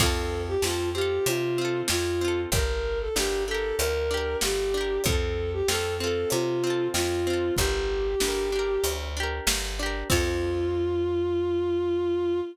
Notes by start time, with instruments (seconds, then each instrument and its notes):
0.00 electric bass (finger) F2, acoustic guitar (steel) C4 F4, violin A4, kick, crash
0.06 acoustic guitar (steel) A4
0.48 violin G4
0.62 electric bass (finger) F2, acoustic guitar (steel) C4, violin F4, snare
0.67 acoustic guitar (steel) F4 A4
0.94 acoustic guitar (steel) C4 F4, violin G4
1.01 acoustic guitar (steel) A4
1.26 electric bass (finger) C3, violin F4, closed hi-hat
1.58 acoustic guitar (steel) C4 F4
1.65 acoustic guitar (steel) A4
1.88 electric bass (finger) F2, violin F4, snare
2.21 acoustic guitar (steel) C4 F4
2.28 acoustic guitar (steel) A4
2.52 electric bass (finger) G1, acoustic guitar (steel) D4, violin A#4, kick, closed hi-hat
2.56 acoustic guitar (steel) G4 A#4
3.00 violin A4
3.16 electric bass (finger) G1, acoustic guitar (steel) D4 G4, violin G4, snare
3.23 acoustic guitar (steel) A#4
3.48 acoustic guitar (steel) D4 G4, violin A4
3.54 acoustic guitar (steel) A#4
3.79 electric bass (finger) D2, violin A#4, closed hi-hat
4.11 acoustic guitar (steel) D4 G4
4.17 acoustic guitar (steel) A#4
4.41 electric bass (finger) G1, violin G4, snare
4.74 acoustic guitar (steel) D4 G4
4.81 acoustic guitar (steel) A#4
5.04 electric bass (finger) F2, acoustic guitar (steel) C4, violin A4, kick, closed hi-hat
5.09 acoustic guitar (steel) F4 A4
5.53 violin G4
5.68 electric bass (finger) F2, acoustic guitar (steel) C4 F4, violin A4, snare
5.75 acoustic guitar (steel) A4
6.00 acoustic guitar (steel) C4 F4, violin A4
6.07 acoustic guitar (steel) A4
6.30 electric bass (finger) C3, violin F4, closed hi-hat
6.64 acoustic guitar (steel) C4 F4
6.70 acoustic guitar (steel) A4
6.94 electric bass (finger) F2, violin F4, snare
7.27 acoustic guitar (steel) C4 F4
7.33 acoustic guitar (steel) A4
7.56 electric bass (finger) G1, acoustic guitar (steel) D4, violin G4, kick, closed hi-hat
7.61 acoustic guitar (steel) G4 A#4
8.20 electric bass (finger) G1, acoustic guitar (steel) D4, snare
8.24 acoustic guitar (steel) G4 A#4
8.52 acoustic guitar (steel) D4 G4
8.59 acoustic guitar (steel) A#4
8.84 electric bass (finger) D2, closed hi-hat
9.17 acoustic guitar (steel) D4 G4
9.23 acoustic guitar (steel) A#4
9.47 electric bass (finger) G1, snare
9.79 acoustic guitar (steel) D4 G4
9.86 acoustic guitar (steel) A#4
10.10 electric bass (finger) F2, acoustic guitar (steel) C4 F4, violin F4, kick, crash
10.16 acoustic guitar (steel) A4